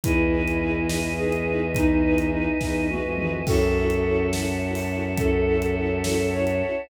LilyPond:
<<
  \new Staff \with { instrumentName = "Flute" } { \time 6/8 \key fis \dorian \tempo 4. = 70 e'8. e'16 e'8 e'8 gis'4 | dis'8. dis'16 dis'8 dis'8 fis'4 | <fis' a'>4. r4. | a'8. a'16 a'8 a'8 cis''4 | }
  \new Staff \with { instrumentName = "String Ensemble 1" } { \time 6/8 \key fis \dorian <dis' e' gis' b'>8 <dis' e' gis' b'>8 <dis' e' gis' b'>8 <dis' e' gis' b'>8 <dis' e' gis' b'>8 <dis' e' gis' b'>8 | <dis' e' gis' b'>8 <dis' e' gis' b'>8 <dis' e' gis' b'>8 <dis' e' gis' b'>8 <dis' e' gis' b'>8 <dis' e' gis' b'>8 | <cis' e' fis' a'>8 <cis' e' fis' a'>8 <cis' e' fis' a'>8 <cis' e' fis' a'>8 <cis' e' fis' a'>8 <cis' e' fis' a'>8 | <cis' e' fis' a'>8 <cis' e' fis' a'>8 <cis' e' fis' a'>8 <cis' e' fis' a'>8 <cis' e' fis' a'>8 <cis' e' fis' a'>8 | }
  \new Staff \with { instrumentName = "Violin" } { \clef bass \time 6/8 \key fis \dorian e,2.~ | e,4. e,8. eis,8. | fis,2.~ | fis,2. | }
  \new Staff \with { instrumentName = "Choir Aahs" } { \time 6/8 \key fis \dorian <b' dis'' e'' gis''>2.~ | <b' dis'' e'' gis''>2. | <cis'' e'' fis'' a''>2.~ | <cis'' e'' fis'' a''>2. | }
  \new DrumStaff \with { instrumentName = "Drums" } \drummode { \time 6/8 <hh bd>8. hh8. sn8. hh8. | <hh bd>8. hh8. <bd sn>8 tommh8 toml8 | <cymc bd>8. hh8. sn8. hho8. | <hh bd>8. hh8. sn8. hh8. | }
>>